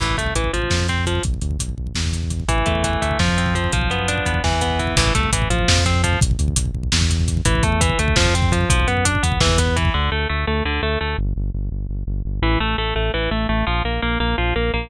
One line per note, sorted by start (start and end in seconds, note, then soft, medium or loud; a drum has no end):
0.00 0.15 A1 medium
0.00 0.16 E3 medium
0.00 kick medium
0.00 crash medium
0.09 kick medium
0.17 0.33 C2 medium
0.17 0.34 A3 medium
0.17 kick medium
0.17 closed hi-hat medium
0.26 kick medium
0.35 0.51 A1 medium
0.35 0.52 E3 medium
0.35 kick medium
0.35 closed hi-hat medium
0.44 kick medium
0.53 0.68 A1 medium
0.53 0.87 F3 medium
0.53 kick medium
0.53 closed hi-hat medium
0.62 kick medium
0.70 1.20 F2 medium
0.70 kick medium
0.70 snare medium
0.80 kick medium
0.88 1.05 C4 medium
0.88 kick medium
0.88 closed hi-hat soft
0.98 kick medium
1.06 1.23 F3 medium
1.06 kick medium
1.06 closed hi-hat medium
1.15 kick medium
1.23 1.39 B1 medium
1.23 kick medium
1.23 closed hi-hat medium
1.34 kick medium
1.41 1.57 D2 medium
1.41 kick medium
1.41 closed hi-hat medium
1.51 kick medium
1.59 1.75 B1 medium
1.59 kick medium
1.59 closed hi-hat medium
1.69 kick medium
1.77 1.92 B1 soft
1.77 kick medium
1.87 kick medium
1.95 2.44 E2 medium
1.95 kick medium
1.95 snare medium
2.05 kick medium
2.13 kick medium
2.13 closed hi-hat medium
2.23 kick medium
2.30 kick medium
2.30 closed hi-hat medium
2.40 kick medium
2.48 2.64 A1 medium
2.48 2.84 E3 medium
2.48 kick medium
2.48 closed hi-hat medium
2.58 kick medium
2.66 2.97 E2 medium
2.66 3.01 A3 medium
2.66 kick medium
2.66 closed hi-hat medium
2.75 kick medium
2.84 3.18 E3 medium
2.84 kick medium
2.84 closed hi-hat medium
2.93 kick medium
3.02 3.17 D2 medium
3.02 3.19 A3 medium
3.02 kick medium
3.02 closed hi-hat medium
3.11 kick medium
3.19 3.68 F2 medium
3.19 3.55 F3 medium
3.19 kick medium
3.19 snare medium
3.28 kick medium
3.38 3.71 C4 medium
3.38 kick medium
3.38 closed hi-hat medium
3.46 kick medium
3.55 3.72 F3 medium
3.55 kick medium
3.55 closed hi-hat medium
3.64 kick medium
3.72 3.88 B1 medium
3.72 4.40 F3 medium
3.72 kick medium
3.72 closed hi-hat medium
3.81 kick medium
3.90 4.20 F#2 medium
3.90 4.25 B3 medium
3.90 kick medium
3.90 closed hi-hat soft
3.99 kick medium
4.08 4.42 D4 medium
4.08 kick medium
4.08 closed hi-hat medium
4.18 kick medium
4.26 4.41 E2 medium
4.26 4.43 B3 medium
4.26 kick medium
4.26 closed hi-hat medium
4.34 kick medium
4.44 4.93 E2 medium
4.44 4.79 E3 medium
4.44 kick medium
4.44 snare medium
4.52 kick medium
4.61 4.95 B3 medium
4.61 kick medium
4.61 closed hi-hat medium
4.70 kick medium
4.79 4.96 E3 medium
4.79 kick medium
4.79 closed hi-hat medium
4.87 kick medium
4.97 5.12 A1 medium
4.97 5.13 E3 loud
4.97 kick loud
4.97 crash loud
5.06 kick medium
5.15 5.30 C2 medium
5.15 5.31 A3 medium
5.15 kick medium
5.15 closed hi-hat medium
5.23 kick medium
5.33 5.48 A1 medium
5.33 5.49 E3 medium
5.33 kick medium
5.33 closed hi-hat medium
5.42 kick medium
5.50 5.65 A1 medium
5.50 5.84 F3 medium
5.50 kick medium
5.50 closed hi-hat medium
5.59 kick medium
5.68 6.17 F2 loud
5.68 kick medium
5.68 snare loud
5.78 kick medium
5.86 6.02 C4 medium
5.86 kick medium
5.86 closed hi-hat medium
5.94 kick medium
6.04 6.20 F3 medium
6.04 kick medium
6.04 closed hi-hat medium
6.13 kick medium
6.21 6.36 B1 medium
6.21 kick loud
6.21 closed hi-hat medium
6.31 kick medium
6.39 6.54 D2 medium
6.39 kick medium
6.39 closed hi-hat medium
6.48 kick medium
6.56 6.72 B1 medium
6.56 kick medium
6.56 closed hi-hat loud
6.65 kick medium
6.74 6.90 B1 medium
6.74 kick medium
6.83 kick medium
6.92 7.42 E2 medium
6.92 kick medium
6.92 snare loud
7.01 kick medium
7.10 kick medium
7.10 closed hi-hat medium
7.20 kick medium
7.28 kick medium
7.28 closed hi-hat medium
7.37 kick medium
7.45 7.61 A1 medium
7.45 7.63 E3 loud
7.45 kick medium
7.45 closed hi-hat medium
7.55 kick medium
7.63 7.94 E2 medium
7.63 7.81 A3 medium
7.63 kick medium
7.63 closed hi-hat medium
7.72 kick medium
7.81 7.98 E3 medium
7.81 kick medium
7.81 closed hi-hat medium
7.89 kick medium
7.99 8.14 D2 medium
7.99 8.16 A3 medium
7.99 kick medium
7.99 closed hi-hat medium
8.08 kick medium
8.16 8.66 F2 medium
8.16 8.34 F3 loud
8.16 kick medium
8.16 snare loud
8.25 kick medium
8.34 8.52 C4 medium
8.34 kick medium
8.34 closed hi-hat medium
8.42 kick medium
8.52 8.69 F3 medium
8.52 kick medium
8.52 closed hi-hat medium
8.61 kick medium
8.70 8.85 B1 medium
8.70 8.88 F3 medium
8.70 kick loud
8.70 closed hi-hat medium
8.80 kick medium
8.87 9.18 F#2 medium
8.87 9.05 B3 medium
8.87 kick medium
8.87 closed hi-hat medium
8.97 kick medium
9.05 9.23 D4 medium
9.05 kick medium
9.05 closed hi-hat loud
9.15 kick medium
9.23 9.38 E2 medium
9.23 9.40 B3 medium
9.23 kick medium
9.23 closed hi-hat medium
9.32 kick medium
9.40 9.90 E2 medium
9.40 9.59 E3 loud
9.40 kick medium
9.40 snare loud
9.49 kick medium
9.58 9.76 B3 medium
9.58 kick medium
9.58 closed hi-hat medium
9.67 kick medium
9.76 9.93 E3 medium
9.76 kick medium
9.76 closed hi-hat medium
9.85 kick medium
9.94 10.10 D2 medium
9.94 10.10 D3 medium
10.12 10.27 D2 medium
10.12 10.28 A3 medium
10.29 10.45 D2 medium
10.29 10.45 A3 medium
10.47 10.63 D2 medium
10.47 10.63 A3 medium
10.65 10.80 D2 medium
10.65 10.81 D3 medium
10.83 10.98 D2 medium
10.83 10.99 A3 medium
11.01 11.16 D2 medium
11.01 11.17 A3 medium
11.18 11.33 G1 medium
11.36 11.51 G1 medium
11.54 11.69 G1 medium
11.72 11.87 G1 medium
11.89 12.04 G1 medium
12.07 12.22 G1 medium
12.25 12.40 G1 medium
12.42 12.57 A1 medium
12.42 12.59 E3 medium
12.60 12.75 A1 medium
12.60 12.76 A3 medium
12.78 12.93 A1 medium
12.78 12.94 A3 medium
12.95 13.11 A1 medium
12.95 13.12 A3 medium
13.14 13.29 A1 medium
13.14 13.30 E3 medium
13.31 13.46 A1 medium
13.31 13.47 A3 medium
13.49 13.64 A1 medium
13.49 13.65 A3 medium
13.67 13.82 A#1 medium
13.67 13.83 F3 medium
13.84 13.99 A#1 medium
13.84 14.01 A#3 medium
14.02 14.18 A#1 medium
14.02 14.18 A#3 medium
14.20 14.35 A#1 medium
14.20 14.36 A#3 medium
14.38 14.53 A#1 medium
14.38 14.54 F3 medium
14.56 14.71 A#1 medium
14.56 14.72 A#3 medium
14.73 14.88 A#1 medium
14.73 14.90 A#3 medium